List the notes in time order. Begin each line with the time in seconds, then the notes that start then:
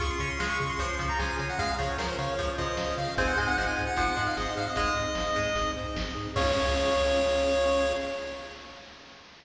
0.00 C#2 C#4 F4 G#4 C#6, kick, closed hi-hat
0.10 C6
0.19 C#3 C#4 C#5 C#6, closed hi-hat
0.30 C6
0.39 C#2 G#3 F5 C6, snare
0.50 C#6
0.58 C#3 G#4, kick, closed hi-hat
0.69 C6
0.79 C#2 F3 C#5, kick, closed hi-hat
0.99 C#3 F3 F5, kick, closed hi-hat
1.09 A#5
1.19 C#2 G#4 G#5, snare
1.39 C#3 C#5 G#5, closed hi-hat
1.49 F#5
1.58 C#2 G#3 F5, kick, closed hi-hat
1.78 C#3 F3 G#4 C#5, closed hi-hat
1.98 C#2 F3 A#4 C#5, snare
2.09 C5
2.18 C#3 C#5 F5, closed hi-hat
2.38 C#2 F3 G#4, kick, closed hi-hat
2.58 C#3 F3 C#5 D#5, kick, closed hi-hat
2.77 C#2 F5, snare
2.97 C#3 G#4 F5, open hi-hat
3.17 G#1 C4 D#4 G#4 G#5, kick, closed hi-hat
3.27 F#5
3.37 G#2 G#3 C5 G#5, closed hi-hat
3.48 F#5
3.57 G#1 F3 D#5 F#5, snare
3.68 G#5
3.76 G#2 G#4, kick, closed hi-hat
3.87 F#5
3.96 G#1 F3 C5, kick, closed hi-hat
4.17 G#2 F3 D#5, kick, closed hi-hat
4.27 F5
4.37 G#1 G#4 D#5, snare
4.57 G#2 C5 F5, closed hi-hat
4.67 D#5
4.76 G#1 G#3 D#5, kick, closed hi-hat
4.96 G#2 G#4, closed hi-hat
5.15 G#1 C5, snare
5.36 G#2 G#3 D#5, kick, closed hi-hat
5.55 G#1 G#4, kick, closed hi-hat
5.76 G#2 C5, kick, closed hi-hat
5.96 G#1 D#5, snare
6.15 G#2 G#4, closed hi-hat
6.36 C#2 C#4 F4 G#4 C#5 F5, kick, crash